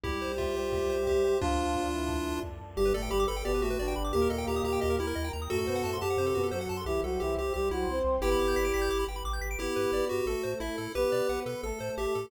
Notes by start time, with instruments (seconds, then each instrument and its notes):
0.03 synth bass 1 C2, brass section G3 G4, lead 1 (square) E4 G4, pad 2 (warm) C5 E5 G5, kick
0.22 lead 1 (square) C5
0.38 lead 1 (square) F4 E5, kick
0.56 lead 1 (square) C5
0.72 lead 1 (square) G4, pad 2 (warm) C5 G5 C6, kick
0.90 lead 1 (square) C5
1.07 lead 1 (square) G4 E5, kick
1.24 lead 1 (square) C5
1.40 synth bass 1 D2, brass section F3 F4, lead 1 (square) D4 F4, pad 2 (warm) D5 F5 A5, kick
1.75 kick
1.93 brass section E3 E4
2.08 pad 2 (warm) A4 D5 A5, kick
2.43 synth bass 1 F2, kick
2.61 synth bass 1 F#2
2.76 synth bass 1 G1, brass section G2 G3, lead 1 (square) G4, pad 2 (warm) B4 D5 G5
2.86 lead 1 (square) B4
2.94 synth bass 1 G1, brass section A2 A3, lead 1 (square) A4 D5
3.02 lead 1 (square) G5
3.10 synth bass 1 G1, brass section G2 G3, lead 1 (square) G4 B5
3.20 lead 1 (square) D6
3.28 synth bass 1 G1, lead 1 (square) A4 B5
3.37 lead 1 (square) G5
3.44 synth bass 1 G1, brass section B2 B3, lead 1 (square) G4 D5, pad 2 (warm) G4 B4 G5
3.54 lead 1 (square) B4
3.62 synth bass 1 G1, brass section A2 A3, lead 1 (square) F#4 G4
3.70 lead 1 (square) B4
3.79 synth bass 1 G1, brass section D3 D4, lead 1 (square) D5
3.88 lead 1 (square) G5
3.96 synth bass 1 G1, lead 1 (square) B5
4.04 lead 1 (square) D6
4.13 synth bass 1 D#2, brass section A#2 A#3, lead 1 (square) G4, pad 2 (warm) A#4 D#5 G5
4.22 lead 1 (square) A#4
4.30 synth bass 1 D#2, lead 1 (square) A4 D#5
4.38 lead 1 (square) G5
4.47 synth bass 1 D#2, lead 1 (square) G4 A#5
4.56 lead 1 (square) D#6
4.64 synth bass 1 D#2, lead 1 (square) G4 A#5
4.73 lead 1 (square) G5
4.81 synth bass 1 D#2, lead 1 (square) G4 D#5, pad 2 (warm) A#4 G5 A#5
4.90 lead 1 (square) A#4
4.99 synth bass 1 D#2, lead 1 (square) E4 G4
5.07 lead 1 (square) A#4
5.15 synth bass 1 D#2, lead 1 (square) D#5
5.24 lead 1 (square) G5
5.33 synth bass 1 D#2, lead 1 (square) A#5
5.42 lead 1 (square) D#6
5.49 synth bass 1 F#2, brass section A2 A3, lead 1 (square) F#4 A4, pad 2 (warm) A4 C5 F#5
5.58 lead 1 (square) A4
5.67 synth bass 1 F#2, brass section B2 B3, lead 1 (square) C5
5.76 lead 1 (square) F#5
5.84 synth bass 1 F#2, brass section A2 A3, lead 1 (square) A5
5.93 lead 1 (square) C6
6.01 synth bass 1 F#2, lead 1 (square) G4 A5
6.10 lead 1 (square) F#5
6.17 synth bass 1 F#2, brass section C3 C4, pad 2 (warm) F#4 A4 F#5, lead 1 (square) C5
6.26 lead 1 (square) A4
6.35 synth bass 1 F#2, brass section B2 B3, lead 1 (square) F#4
6.43 lead 1 (square) A4
6.51 synth bass 1 F#2, brass section F#3 F#4, lead 1 (square) A4 C5
6.61 lead 1 (square) F#5
6.69 synth bass 1 F#2, lead 1 (square) A5
6.77 lead 1 (square) C6
6.86 synth bass 1 C2, brass section E3 E4, lead 1 (square) G4, pad 2 (warm) C5 E5 G5
7.03 synth bass 1 C2, brass section F#3 F#4, lead 1 (square) A4
7.20 synth bass 1 C2, brass section E3 E4, lead 1 (square) G4
7.37 synth bass 1 C2, lead 1 (square) G4
7.54 synth bass 1 C2, brass section G3 G4, lead 1 (square) G4, pad 2 (warm) C5 G5 C6
7.71 synth bass 1 C2, brass section F#3 F#4, lead 1 (square) E4
7.87 synth bass 1 C2, brass section C4 C5
8.04 synth bass 1 C2
8.21 synth bass 1 G1, brass section B3 B4, lead 1 (square) E4 G4 G5, pad 2 (warm) B4 D5 G5
8.32 lead 1 (square) B5
8.39 synth bass 1 G1, lead 1 (square) D6
8.48 lead 1 (square) G6
8.56 synth bass 1 G1, lead 1 (square) B6
8.65 lead 1 (square) D7
8.74 synth bass 1 G1, lead 1 (square) B6
8.82 lead 1 (square) G6
8.89 synth bass 1 G1, pad 2 (warm) G4 B4 G5, lead 1 (square) D6
8.99 lead 1 (square) B5
9.08 synth bass 1 G1, lead 1 (square) G5
9.16 lead 1 (square) B5
9.24 synth bass 1 A1, lead 1 (square) D6
9.33 lead 1 (square) G6
9.41 synth bass 1 G#1, lead 1 (square) B6
9.51 lead 1 (square) D7
9.59 synth bass 1 G1, brass section B3 B4, lead 1 (square) E4 G4
9.76 synth bass 1 G2, lead 1 (square) B4
9.92 synth bass 1 G1, brass section B3 B4, lead 1 (square) D5
10.09 synth bass 1 G2, lead 1 (square) F#4 G4
10.26 synth bass 1 A1, brass section A3 A4, lead 1 (square) A4
10.43 synth bass 1 A2, lead 1 (square) C5
10.60 synth bass 1 A1, lead 1 (square) E4 E5
10.78 synth bass 1 A2, lead 1 (square) A4
10.95 synth bass 1 B1, brass section B3 B4, lead 1 (square) G4 B4
11.12 synth bass 1 B2, lead 1 (square) D5
11.29 synth bass 1 B1, brass section B3 B4, lead 1 (square) F#5
11.46 synth bass 1 B2, lead 1 (square) A4 B4
11.63 synth bass 1 A1, brass section A3 A4, lead 1 (square) A4
11.80 synth bass 1 A2, lead 1 (square) C5
11.97 synth bass 1 A1, lead 1 (square) G4 E5
12.15 synth bass 1 A2, lead 1 (square) A4